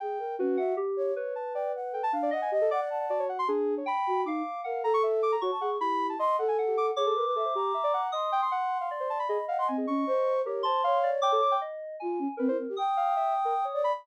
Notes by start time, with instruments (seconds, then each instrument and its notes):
0.00 flute G#4, ocarina G5
0.19 flute A#4
0.39 flute C#4, ocarina F#4, electric piano 2 B4
0.57 flute E5, electric piano 2 F#5
0.77 electric piano 2 G4
0.97 flute C#5
1.16 electric piano 2 B4, ocarina C#5
1.35 ocarina A5
1.54 ocarina D5, flute G5
1.75 flute F#5
1.92 flute A4, ocarina G5
2.03 ocarina A5
2.12 electric piano 2 D4, flute F5
2.23 ocarina D5
2.31 electric piano 2 D#5, ocarina D#5, flute F#5
2.42 ocarina G#5
2.52 ocarina G4, flute D#5
2.61 ocarina A4
2.71 electric piano 2 D5, flute F#5, ocarina D6
2.81 ocarina F#5
2.90 flute A5
3.00 ocarina F#5
3.10 electric piano 2 F#4, ocarina D5
3.19 ocarina C#5
3.29 ocarina F#5
3.39 ocarina C6
3.48 electric piano 2 D4, ocarina G#4
3.77 ocarina C#5
3.86 electric piano 2 G5, ocarina B5
4.07 flute F#4
4.25 flute D#4, electric piano 2 F5, ocarina D6
4.64 flute A#4, ocarina F5, electric piano 2 F#5
4.83 flute A4, ocarina A#5
4.94 ocarina C#6
5.03 ocarina E5
5.23 ocarina D6
5.32 ocarina A#5
5.41 ocarina F#4, flute C#5, electric piano 2 C#6
5.51 flute A5
5.61 flute G#4, ocarina F#5
5.80 electric piano 2 E4, flute G4, ocarina B5
6.09 ocarina A5
6.19 ocarina D#5, flute C6
6.39 flute A4, ocarina F#5
6.48 ocarina G#5
6.58 electric piano 2 F#5
6.68 ocarina G4
6.77 ocarina D6
6.96 flute G#4, ocarina C#5, electric piano 2 D6
7.06 ocarina A4
7.16 flute A#4, ocarina B4
7.26 flute B4
7.36 ocarina A4, flute E5
7.45 ocarina C5
7.55 ocarina G4, flute A#5
7.74 ocarina E5
7.84 ocarina D5
7.94 ocarina F#5
8.12 ocarina D#5, flute C6, electric piano 2 D#6
8.32 ocarina G5
8.42 ocarina C6
8.51 electric piano 2 F#5, ocarina F#5
8.81 ocarina F5
8.91 electric piano 2 D5
9.00 ocarina C5
9.10 ocarina A5
9.19 ocarina B5
9.27 ocarina G#4, electric piano 2 D#5, flute B5
9.48 ocarina F5, flute F#5
9.58 ocarina F#5, flute C6
9.68 flute C4, ocarina G#5
9.78 ocarina G#4
9.87 flute C#4, ocarina C#6
10.07 flute C5
10.45 electric piano 2 G4, ocarina A#4, flute C#5
10.63 flute C5, ocarina A5, electric piano 2 C6
10.84 flute C#5, ocarina F5
11.03 electric piano 2 D5
11.22 ocarina G5, electric piano 2 D6
11.32 ocarina A4
11.42 ocarina D6
11.51 ocarina G5
11.61 electric piano 2 D#5
12.00 flute F4, electric piano 2 G#5
12.19 flute C#4
12.37 flute C4, electric piano 2 A#4, ocarina B4
12.48 flute E4, ocarina C5
12.59 flute C4
12.69 flute G4
12.77 flute G5, electric piano 2 D#6
12.97 ocarina F5
13.16 ocarina E5
13.45 ocarina A#4
13.65 ocarina C#5
13.74 ocarina C#5, flute D5
13.84 ocarina B5